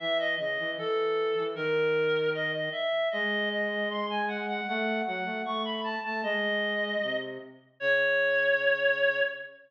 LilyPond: <<
  \new Staff \with { instrumentName = "Clarinet" } { \time 2/2 \key cis \minor \tempo 2 = 77 e''8 dis''8 dis''4 a'2 | ais'2 dis''8 dis''8 e''4 | dis''4 dis''4 bis''8 gis''8 fis''8 fis''8 | fis''4 fis''4 cis'''8 b''8 a''8 a''8 |
dis''2~ dis''8 r4. | cis''1 | }
  \new Staff \with { instrumentName = "Flute" } { \time 2/2 \key cis \minor e4 cis8 e8 e4. e8 | dis2. r4 | gis1 | a4 fis8 a8 a4. a8 |
gis2 bis,4 r4 | cis1 | }
>>